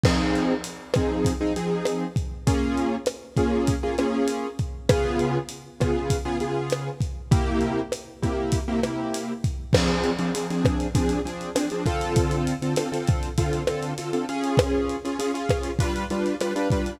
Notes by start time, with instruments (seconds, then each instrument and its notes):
0.04 acoustic grand piano F3 C4 D#4 G#4, kick, cross-stick, crash
0.35 closed hi-hat
0.64 closed hi-hat
0.94 acoustic grand piano F3 C4 D#4 G#4, kick, cross-stick, closed hi-hat
1.25 kick, closed hi-hat
1.41 acoustic grand piano F3 C4 D#4 G#4
1.56 acoustic grand piano F3 C4 D#4 G#4, closed hi-hat
1.85 cross-stick, closed hi-hat
2.16 kick, closed hi-hat
2.47 acoustic grand piano A#3 C#4 F4 G#4, kick, closed hi-hat
2.78 closed hi-hat
3.06 cross-stick, closed hi-hat
3.36 acoustic grand piano A#3 C#4 F4 G#4, kick, closed hi-hat
3.67 kick, closed hi-hat
3.83 acoustic grand piano A#3 C#4 F4 G#4
3.98 acoustic grand piano A#3 C#4 F4 G#4, cross-stick, closed hi-hat
4.28 closed hi-hat
4.59 kick, closed hi-hat
4.89 acoustic grand piano C#3 B3 F4 G#4, kick, cross-stick, closed hi-hat
5.19 closed hi-hat
5.49 closed hi-hat
5.80 acoustic grand piano C#3 B3 F4 G#4, kick, cross-stick, closed hi-hat
6.10 kick, closed hi-hat
6.25 acoustic grand piano C#3 B3 F4 G#4
6.40 acoustic grand piano C#3 B3 F4 G#4, closed hi-hat
6.70 cross-stick, closed hi-hat
7.01 kick, closed hi-hat
7.31 acoustic grand piano C3 A#3 E4 G4, kick, closed hi-hat
7.61 closed hi-hat
7.92 cross-stick, closed hi-hat
8.22 acoustic grand piano C3 A#3 E4 G4, kick, closed hi-hat
8.52 kick, closed hi-hat
8.68 acoustic grand piano C3 A#3 E4 G4
8.83 acoustic grand piano C3 A#3 E4 G4, cross-stick, closed hi-hat
9.14 closed hi-hat
9.44 kick, closed hi-hat
9.73 acoustic grand piano F3 C4 D4 G#4, kick, cross-stick, crash
9.88 closed hi-hat
10.04 closed hi-hat
10.19 acoustic grand piano F3 C4 D4 G#4, closed hi-hat
10.34 acoustic grand piano F3 C4 D4 G#4, closed hi-hat
10.50 acoustic grand piano F3 C4 D4 G#4, closed hi-hat
10.65 kick, cross-stick, closed hi-hat
10.80 closed hi-hat
10.95 acoustic grand piano F3 C4 D4 G#4, kick, closed hi-hat
11.09 closed hi-hat
11.25 acoustic grand piano F3 C4 D4 G#4, closed hi-hat
11.41 closed hi-hat
11.55 acoustic grand piano F3 C4 D4 G#4, cross-stick, closed hi-hat
11.70 acoustic grand piano F3 C4 D4 G#4, closed hi-hat
11.86 acoustic grand piano D3 C4 F4 A4, kick, closed hi-hat
12.01 closed hi-hat
12.16 kick, closed hi-hat
12.31 closed hi-hat
12.47 closed hi-hat
12.62 acoustic grand piano D3 C4 F4 A4, closed hi-hat
12.76 acoustic grand piano D3 C4 F4 A4, cross-stick, closed hi-hat
12.92 acoustic grand piano D3 C4 F4 A4, closed hi-hat
13.07 kick, closed hi-hat
13.23 closed hi-hat
13.38 acoustic grand piano D3 C4 F4 A4, kick, closed hi-hat
13.53 closed hi-hat
13.67 acoustic grand piano D3 C4 F4 A4, cross-stick, closed hi-hat
13.83 closed hi-hat
13.98 acoustic grand piano D3 C4 F4 A4, closed hi-hat
14.13 acoustic grand piano D3 C4 F4 A4, closed hi-hat
14.29 acoustic grand piano C#4 F4 G#4, closed hi-hat
14.44 closed hi-hat
14.57 kick, cross-stick, closed hi-hat
14.89 closed hi-hat
15.05 acoustic grand piano C#4 F4 G#4, closed hi-hat
15.19 acoustic grand piano C#4 F4 G#4, closed hi-hat
15.34 acoustic grand piano C#4 F4 G#4, closed hi-hat
15.49 kick, cross-stick, closed hi-hat
15.63 closed hi-hat
15.79 acoustic grand piano G3 D4 F4 B4, kick, closed hi-hat
15.96 closed hi-hat
16.10 acoustic grand piano G3 D4 F4 B4, closed hi-hat
16.26 closed hi-hat
16.41 acoustic grand piano G3 D4 F4 B4, cross-stick, closed hi-hat
16.56 acoustic grand piano G3 D4 F4 B4, closed hi-hat
16.70 acoustic grand piano G3 D4 F4 B4, kick, closed hi-hat
16.86 closed hi-hat